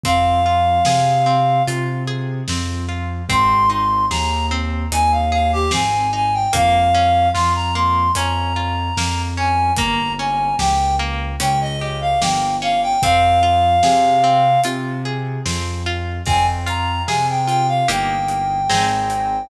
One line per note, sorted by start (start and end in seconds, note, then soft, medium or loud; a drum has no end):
0.03 0.78 F2 medium
0.03 0.41 C4 loud
0.03 1.63 F5 medium
0.03 kick medium
0.03 closed hi-hat medium
0.46 0.82 F4 medium
0.85 1.59 C3 medium
0.85 1.23 G#4 medium
0.85 snare medium
1.26 1.63 C4 medium
1.67 2.40 C3 medium
1.67 2.04 F4 loud
1.67 closed hi-hat medium
2.07 2.44 G#4 medium
2.48 3.21 F2 medium
2.48 2.86 C4 medium
2.48 snare medium
2.89 3.25 F4 medium
3.29 4.02 G#1 loud
3.29 3.66 C4 loud
3.29 3.69 C6 medium
3.29 kick medium
3.29 closed hi-hat medium
3.70 4.06 D#4 medium
3.70 4.05 C6 medium
4.10 4.83 D#2 medium
4.10 4.47 G#4 medium
4.10 4.46 A#5 medium
4.10 snare medium
4.51 4.88 C4 medium
4.92 5.65 D#2 medium
4.92 5.29 D#4 medium
4.92 5.12 G#5 medium
4.92 closed hi-hat medium
5.12 5.31 F5 medium
5.32 5.68 G#4 medium
5.32 5.51 F5 medium
5.53 5.72 G4 medium
5.71 6.46 G#1 medium
5.71 6.08 C4 medium
5.71 6.10 G#5 medium
5.71 snare medium
6.13 6.49 D#4 medium
6.13 6.34 G#5 medium
6.33 6.53 G5 medium
6.53 7.27 F2 medium
6.53 6.89 A#3 loud
6.53 7.28 F5 medium
6.53 kick medium
6.53 closed hi-hat medium
6.94 7.31 C#4 loud
7.33 8.08 F2 medium
7.33 7.71 F4 medium
7.33 7.53 C6 medium
7.33 snare medium
7.55 7.74 A#5 medium
7.75 8.12 A#3 medium
7.75 8.11 C6 medium
8.15 8.89 F2 medium
8.15 8.53 C#4 loud
8.15 9.22 A#5 medium
8.15 closed hi-hat medium
8.56 8.93 F4 medium
8.97 9.70 F2 medium
8.97 9.34 A#3 medium
8.97 snare medium
9.37 9.74 C#4 medium
9.37 9.72 G#5 medium
9.77 10.51 G1 medium
9.77 10.15 A#3 loud
9.77 10.12 A#5 medium
9.77 kick medium
9.77 closed hi-hat medium
10.19 10.56 C#4 medium
10.19 10.56 G#5 medium
10.59 11.32 C#2 medium
10.59 10.96 G4 medium
10.59 10.95 G5 medium
10.59 snare medium
10.99 11.36 A#3 medium
11.40 12.13 C#2 medium
11.40 11.76 C#4 loud
11.40 11.59 G5 medium
11.40 closed hi-hat loud
11.61 11.80 D#5 medium
11.80 12.18 G4 medium
11.80 12.00 D#5 medium
12.01 12.20 F5 medium
12.21 12.94 G1 medium
12.21 12.58 A#3 medium
12.21 12.55 G5 medium
12.21 snare loud
12.62 12.98 C#4 medium
12.62 12.81 F5 medium
12.83 13.02 G5 medium
13.02 13.76 F2 loud
13.02 13.40 C4 loud
13.02 14.61 F5 medium
13.02 kick medium
13.02 closed hi-hat medium
13.43 13.79 F4 medium
13.83 14.56 C3 medium
13.83 14.20 G#4 medium
13.83 snare medium
14.24 14.60 C4 loud
14.64 15.38 C3 medium
14.64 15.01 F4 medium
14.64 closed hi-hat medium
15.05 15.42 G#4 medium
15.46 16.19 F2 medium
15.46 15.82 C4 medium
15.46 snare medium
15.86 16.23 F4 medium
16.26 17.00 F2 medium
16.26 17.81 C4 loud
16.26 16.46 G#5 medium
16.26 kick medium
16.26 crash medium
16.66 17.47 F4 medium
16.66 17.03 A#5 medium
16.66 closed hi-hat medium
17.07 17.81 C3 medium
17.07 17.85 G#4 loud
17.07 17.26 G#5 medium
17.07 snare medium
17.29 17.47 G5 medium
17.47 17.86 F4 medium
17.47 17.67 G5 medium
17.47 closed hi-hat medium
17.68 17.88 F5 medium
17.88 18.64 G1 medium
17.88 18.61 A#3 loud
17.88 18.61 D#4 loud
17.88 18.61 G4 loud
17.88 19.46 G5 medium
17.88 closed hi-hat medium
18.28 closed hi-hat medium
18.69 19.45 G#1 medium
18.69 19.42 C4 loud
18.69 19.42 D#4 loud
18.69 19.42 G#4 loud
18.69 snare medium
19.10 closed hi-hat medium